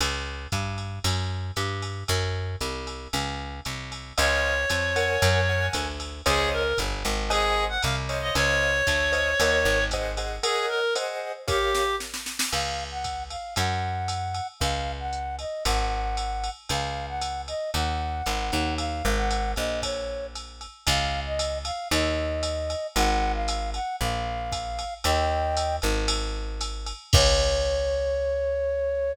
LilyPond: <<
  \new Staff \with { instrumentName = "Clarinet" } { \time 4/4 \key des \major \tempo 4 = 115 r1 | r1 | des''2. r4 | aes'8 bes'8 r4 aes'8. ges''16 f''16 r8 ees''16 |
des''2. r4 | aes'8 bes'8 r4 g'4 r4 | r1 | r1 |
r1 | r1 | r1 | r1 |
r1 | r1 | }
  \new Staff \with { instrumentName = "Flute" } { \time 4/4 \key des \major r1 | r1 | r1 | r1 |
r1 | r1 | f''8. ges''8. f''8 ges''2 | f''8. ges''8. ees''8 ges''2 |
f''8. ges''8. ees''8 ges''2 | f''8. ges''8. ees''8 des''4 r4 | f''8. ees''8. f''8 ees''2 | ges''8. f''8. ges''8 f''2 |
<ees'' g''>4. r2 r8 | des''1 | }
  \new Staff \with { instrumentName = "Acoustic Grand Piano" } { \time 4/4 \key des \major r1 | r1 | <c'' des'' ees'' f''>4. <bes' des'' ges'' aes''>4 <bes' des'' ges'' aes''>4. | <c'' des'' ees'' f''>2 <c'' ees'' ges'' aes''>4. <c'' des'' ees'' f''>8~ |
<c'' des'' ees'' f''>4. <c'' des'' ees'' f''>8 <bes' des'' ees'' ges''>4 <aes' c'' ees'' ges''>8 <aes' c'' ees'' ges''>8 | <bes' des'' ees'' ges''>4 <aes' c'' ees'' ges''>4 <g' bes' des'' f''>2 | r1 | r1 |
r1 | r1 | r1 | r1 |
r1 | r1 | }
  \new Staff \with { instrumentName = "Electric Bass (finger)" } { \clef bass \time 4/4 \key des \major des,4 g,4 ges,4 g,4 | ges,4 c,4 des,4 c,4 | des,4 f,4 ges,4 d,4 | des,4 g,,8 aes,,4. c,4 |
des,4 d,4 ees,8 aes,,4. | r1 | des,2 ges,2 | des,2 aes,,2 |
des,2 ees,4 aes,,8 ees,8~ | ees,8 aes,,4 bes,,2~ bes,,8 | des,2 ees,2 | aes,,2 bes,,2 |
ees,4. aes,,2~ aes,,8 | des,1 | }
  \new DrumStaff \with { instrumentName = "Drums" } \drummode { \time 4/4 cymr4 <hhp bd cymr>8 cymr8 cymr4 <hhp cymr>8 cymr8 | <bd cymr>4 <hhp cymr>8 cymr8 cymr4 <hhp cymr>8 cymr8 | cymr4 <hhp cymr>8 cymr8 cymr4 <hhp bd cymr>8 cymr8 | <bd cymr>4 <hhp bd cymr>8 cymr8 cymr4 <hhp cymr>8 cymr8 |
cymr4 <hhp bd cymr>8 cymr8 cymr4 <hhp bd cymr>8 cymr8 | cymr4 <hhp cymr>4 <bd cymr sn>8 sn8 sn16 sn16 sn16 sn16 | <cymc cymr>4 <hhp bd cymr>8 cymr8 cymr4 <hhp cymr>8 cymr8 | <bd cymr>4 hhp8 cymr8 <bd cymr>4 <hhp cymr>8 cymr8 |
cymr4 <hhp cymr>8 cymr8 cymr4 <hhp cymr>8 cymr8 | cymr4 <hhp cymr>8 cymr8 <bd cymr>4 <hhp cymr>8 cymr8 | <bd cymr>4 <hhp cymr>8 cymr8 cymr4 <hhp cymr>8 cymr8 | cymr4 <hhp cymr>8 cymr8 r4 <hhp bd cymr>8 cymr8 |
cymr4 <hhp cymr>8 cymr8 cymr4 <hhp cymr>8 cymr8 | <cymc bd>4 r4 r4 r4 | }
>>